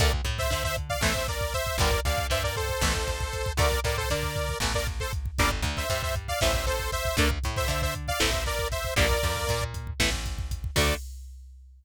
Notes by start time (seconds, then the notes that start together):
0.00 D2 D3 A3 A#4 D5, kick, closed hi-hat
0.13 kick
0.25 A2 A3, kick, closed hi-hat
0.38 C5 E5, kick
0.50 D3 D4 C5 E5, kick, closed hi-hat
0.64 C5 E5, kick
0.77 kick, closed hi-hat
0.89 D5 F5, kick
1.01 A1 E3 A3 C5 E5, kick, snare
1.15 kick
1.28 A#4 D5, kick, closed hi-hat
1.41 kick
1.54 C5 E5, kick, closed hi-hat
1.67 kick
1.78 G1 D3 G3 A#3 A#4 D5, kick, closed hi-hat
1.92 kick
2.05 D2 D3 D5 F5, kick, closed hi-hat
2.18 kick
2.30 G2 G3 C5 E5, kick, closed hi-hat
2.44 A#4 D5, kick
2.56 A4 C5, kick, closed hi-hat
2.69 kick
2.81 A1 E3 A3, kick, snare
2.95 kick
3.08 kick, closed hi-hat
3.21 kick
3.33 kick, closed hi-hat
3.46 kick
3.57 D2 D3 A3 A#4 D5, kick, closed hi-hat
3.72 kick
3.84 A2 A3 A#4 D5, kick, closed hi-hat
3.97 A4 C5, kick
4.10 D3 D4 A#4 D5, kick, closed hi-hat
4.23 kick
4.36 kick, closed hi-hat
4.49 kick
4.60 A1 E3 A3, kick, snare
4.74 A#4 D5, kick
4.87 kick, closed hi-hat
5.00 A4 C5, kick
5.13 kick, closed hi-hat
5.26 kick
5.38 G1 D3 G3 A#3 A#4 D5, kick, closed hi-hat
5.51 kick
5.62 D2 D3, kick, closed hi-hat
5.77 C5 E5, kick
5.90 G2 G3 C5 E5, kick, closed hi-hat
6.03 C5 E5, kick
6.15 kick, closed hi-hat
6.28 D5 F5, kick
6.41 A1 E3 A3 C5 E5, kick, snare
6.54 kick
6.67 A4 C5, kick, closed hi-hat
6.79 kick
6.92 C5 E5, kick, closed hi-hat
7.05 kick
7.17 D2 D3 A3 A#4 D5, kick, closed hi-hat
7.31 kick
7.44 A2 A3, kick, closed hi-hat
7.57 C5 E5, kick
7.68 D3 D4 C5 E5, kick, closed hi-hat
7.82 C5 E5, kick
7.95 kick, closed hi-hat
8.08 D5 F5, kick
8.20 A1 E3 A3 C5 E5, kick, snare
8.33 kick
8.46 A#4 D5, kick, closed hi-hat
8.59 kick
8.72 C5 E5, kick, closed hi-hat
8.85 kick
8.96 A#1 D3 G3 A#3 A#4 D5, kick, closed hi-hat
9.10 kick
9.23 F2 F3, kick, closed hi-hat
9.36 kick
9.47 A#2 A#3, kick, closed hi-hat
9.62 kick
9.74 kick, closed hi-hat
9.87 kick
10.00 A1 E3 A3, kick, snare
10.13 kick
10.26 kick, closed hi-hat
10.38 kick
10.51 kick, closed hi-hat
10.64 kick
10.76 D2 D3 A3 D5, kick, crash